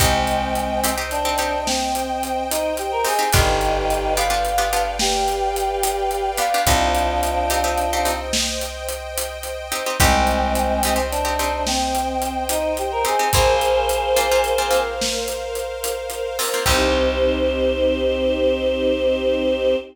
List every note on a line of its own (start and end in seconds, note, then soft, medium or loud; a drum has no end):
0.00 3.06 C2 loud
0.00 0.91 G#3 medium
0.00 0.44 C4 loud
0.00 0.91 C4 loud
0.00 0.44 D#4 medium
0.00 0.44 G4 loud
0.00 3.30 C5 medium
0.00 3.30 D#5 medium
0.00 3.30 G5 medium
0.00 kick loud
0.00 closed hi-hat loud
0.27 closed hi-hat medium
0.55 closed hi-hat medium
0.84 0.95 C4 medium
0.84 0.95 D#4 medium
0.84 0.95 G4 medium
0.84 closed hi-hat loud
0.98 1.20 C4 medium
0.98 1.20 D#4 medium
0.98 1.20 G4 medium
1.11 1.64 D4 loud
1.11 closed hi-hat medium
1.25 1.36 C4 medium
1.25 1.36 D#4 medium
1.25 1.36 G4 medium
1.38 1.83 C4 medium
1.38 1.83 D#4 medium
1.38 1.83 G4 medium
1.38 closed hi-hat medium
1.67 2.44 C4 loud
1.67 snare loud
1.95 closed hi-hat medium
2.23 closed hi-hat medium
2.50 2.73 D#4 loud
2.50 closed hi-hat loud
2.77 2.91 G4 loud
2.77 closed hi-hat medium
2.92 3.05 A#4 loud
3.05 3.16 C4 medium
3.05 3.16 D#4 medium
3.05 3.16 G4 medium
3.05 3.29 G#4 loud
3.05 open hi-hat medium
3.19 3.30 C4 medium
3.19 3.30 D#4 medium
3.19 3.30 G4 medium
3.33 6.40 G1 loud
3.33 3.78 B3 loud
3.33 3.78 D4 loud
3.33 4.13 D#4 loud
3.33 3.78 F4 loud
3.33 4.13 G4 loud
3.33 3.78 G4 medium
3.33 6.63 B4 medium
3.33 6.63 D5 medium
3.33 6.63 F5 medium
3.33 6.63 G5 medium
3.33 kick loud
3.33 closed hi-hat loud
3.61 closed hi-hat medium
3.90 closed hi-hat medium
4.16 4.28 B3 medium
4.16 4.28 D4 medium
4.16 4.28 F4 medium
4.16 4.28 G4 medium
4.16 4.91 F5 loud
4.16 closed hi-hat loud
4.30 4.52 B3 medium
4.30 4.52 D4 medium
4.30 4.52 F4 medium
4.30 4.52 G4 medium
4.45 closed hi-hat medium
4.58 4.69 B3 medium
4.58 4.69 D4 medium
4.58 4.69 F4 medium
4.58 4.69 G4 medium
4.73 5.17 B3 medium
4.73 5.17 D4 medium
4.73 5.17 F4 medium
4.73 5.17 G4 medium
4.73 closed hi-hat medium
4.99 6.30 G4 loud
4.99 snare loud
5.28 closed hi-hat medium
5.56 closed hi-hat medium
5.83 closed hi-hat loud
6.11 closed hi-hat medium
6.38 6.49 B3 medium
6.38 6.49 D4 medium
6.38 6.49 F4 medium
6.38 6.49 G4 medium
6.38 6.62 F5 loud
6.38 closed hi-hat loud
6.54 6.65 B3 medium
6.54 6.65 D4 medium
6.54 6.65 F4 medium
6.54 6.65 G4 medium
6.66 9.73 C2 loud
6.66 7.11 C4 loud
6.66 8.13 D4 loud
6.66 7.11 D#4 loud
6.66 8.13 F4 loud
6.66 7.11 G4 loud
6.66 9.96 C5 medium
6.66 9.96 D#5 medium
6.66 9.96 G5 medium
6.66 kick loud
6.66 closed hi-hat loud
6.95 closed hi-hat medium
7.23 closed hi-hat loud
7.50 7.62 C4 medium
7.50 7.62 D#4 medium
7.50 7.62 G4 medium
7.50 closed hi-hat loud
7.64 7.86 C4 medium
7.64 7.86 D#4 medium
7.64 7.86 G4 medium
7.78 closed hi-hat medium
7.93 8.04 C4 loud
7.93 8.04 D#4 medium
7.93 8.04 G4 medium
8.05 8.50 C4 medium
8.05 8.50 D#4 medium
8.05 8.50 G4 medium
8.05 closed hi-hat loud
8.33 snare loud
8.61 closed hi-hat medium
8.89 closed hi-hat loud
9.18 closed hi-hat loud
9.43 closed hi-hat medium
9.72 9.83 C4 medium
9.72 9.83 D#4 medium
9.72 9.83 G4 medium
9.72 closed hi-hat medium
9.86 9.97 C4 medium
9.86 9.97 D#4 medium
9.86 9.97 G4 medium
10.00 13.06 C2 loud
10.00 10.97 G#3 loud
10.00 10.97 C4 loud
10.00 10.45 C4 loud
10.00 10.45 D#4 loud
10.00 10.45 G4 loud
10.00 13.30 C5 loud
10.00 13.30 D#5 medium
10.00 13.30 G5 medium
10.00 kick loud
10.00 closed hi-hat loud
10.27 closed hi-hat medium
10.55 closed hi-hat loud
10.83 10.95 C4 medium
10.83 10.95 D#4 medium
10.83 10.95 G4 medium
10.83 closed hi-hat loud
10.96 11.18 C4 medium
10.96 11.18 D#4 medium
10.96 11.18 G4 medium
11.11 11.63 D4 loud
11.11 closed hi-hat medium
11.25 11.36 C4 medium
11.25 11.36 D#4 medium
11.25 11.36 G4 medium
11.39 11.84 C4 medium
11.39 11.84 D#4 medium
11.39 11.84 G4 medium
11.39 closed hi-hat medium
11.67 12.44 C4 loud
11.67 snare loud
11.95 closed hi-hat medium
12.22 closed hi-hat medium
12.49 12.73 D#4 loud
12.49 closed hi-hat loud
12.77 12.91 G4 medium
12.77 closed hi-hat medium
12.92 13.05 A#4 loud
13.05 13.16 C4 medium
13.05 13.16 D#4 medium
13.05 13.16 G4 medium
13.05 13.28 G#4 loud
13.05 closed hi-hat medium
13.19 13.30 C4 medium
13.19 13.30 D#4 medium
13.19 13.30 G4 medium
13.33 16.40 A#1 medium
13.33 13.79 A#3 loud
13.33 13.79 C4 loud
13.33 13.79 F4 loud
13.33 14.80 G#4 loud
13.33 16.64 A#4 medium
13.33 14.80 C5 loud
13.33 16.64 C5 loud
13.33 16.64 F5 medium
13.33 kick loud
13.33 closed hi-hat loud
13.61 closed hi-hat medium
13.89 closed hi-hat loud
14.16 14.28 A#3 medium
14.16 14.28 C4 medium
14.16 14.28 F4 medium
14.16 closed hi-hat loud
14.31 14.54 A#3 medium
14.31 14.54 C4 medium
14.31 14.54 F4 loud
14.44 closed hi-hat medium
14.58 14.69 A#3 medium
14.58 14.69 C4 medium
14.58 14.69 F4 medium
14.71 15.15 A#3 medium
14.71 15.15 C4 medium
14.71 15.15 F4 medium
14.71 closed hi-hat medium
15.01 snare loud
15.28 closed hi-hat medium
15.55 closed hi-hat medium
15.84 closed hi-hat loud
16.10 closed hi-hat medium
16.39 16.50 A#3 medium
16.39 16.50 C4 medium
16.39 16.50 F4 medium
16.39 open hi-hat loud
16.54 16.65 A#3 medium
16.54 16.65 C4 medium
16.54 16.65 F4 medium
16.66 19.75 C2 loud
16.66 19.75 C4 loud
16.66 19.76 C4 loud
16.66 19.75 D#4 loud
16.66 19.76 D#4 loud
16.66 19.75 G4 loud
16.66 19.76 G4 loud
16.66 19.76 C5 loud
16.66 kick loud
16.66 crash loud